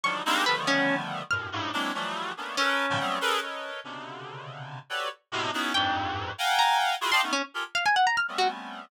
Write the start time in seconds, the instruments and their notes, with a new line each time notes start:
0.04 clarinet D3 D#3 F3 F#3 G3, orchestral harp C#6
0.25 clarinet G3 G#3 A#3 C4 D4 D#4
0.46 clarinet D3 D#3 F3 G3 A3 B3, orchestral harp B4
0.67 orchestral harp C#4
1.31 clarinet F#2 G2 A2 B2, orchestral harp F6
1.52 clarinet G2 G#2 A2
1.73 clarinet F#3 G#3 A#3 C4 D4 E4
1.94 clarinet E3 F3 F#3 G3 A3
2.37 clarinet A3 A#3 B3 C#4 D4
2.57 orchestral harp C#4, clarinet A4 A#4 B4
2.90 clarinet G#2 A#2 B2 C#3 D#3 F3
2.99 clarinet F#3 G3 A3 B3 C4
3.21 clarinet G#4 A4 A#4 B4
3.42 clarinet A4 A#4 B4 C#5 D#5
3.84 clarinet B2 C3 C#3 D3
4.90 clarinet F#4 G4 A4 B4 C#5 D5
5.32 clarinet A2 B2 C3
5.53 clarinet B3 C#4 D#4 E4 F#4 G#4
5.74 clarinet F2 G2 G#2, orchestral harp G5
6.38 clarinet F5 F#5 G5 G#5 A#5
6.59 orchestral harp A#5
7.01 clarinet E4 F4 F#4 G#4
7.11 clarinet D5 D#5 F5 G5 A5, orchestral harp C6
7.22 clarinet A3 B3 C#4 D#4
7.33 orchestral harp C#4
7.54 clarinet F4 G4 G#4 A4 A#4
7.75 orchestral harp F5
7.86 orchestral harp G#5
7.96 orchestral harp F#5
8.07 orchestral harp A#5
8.17 orchestral harp F6
8.28 clarinet G3 A3 B3 C4 C#4
8.38 orchestral harp F#4